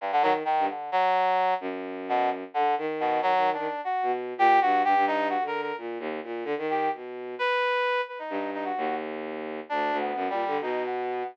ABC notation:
X:1
M:7/8
L:1/16
Q:1/4=130
K:none
V:1 name="Violin" clef=bass
z2 _E,2 z G,, z8 | _G,,8 D,2 _E,4 | _E, E,2 E, z3 B,,3 _B,,2 G,,2 | G,, G,,4 D,3 _B,,2 _E,,2 B,,2 |
D, _E,3 B,,4 z6 | z2 G,,4 _E,,8 | D,,2 D,,2 (3_G,,2 _B,,2 D,2 =B,,6 |]
V:2 name="Brass Section"
G,, D, _G, z _E,2 D,2 G,6 | z4 B,,2 z2 D,2 z2 B,,2 | (3_G,4 D4 _G4 z2 =G2 _G2 | G2 _E2 (3_G2 _B2 B2 z6 |
z2 G2 z4 B6 | B _E3 E _G3 z6 | (3D4 B,4 G,4 _E2 B,4 |]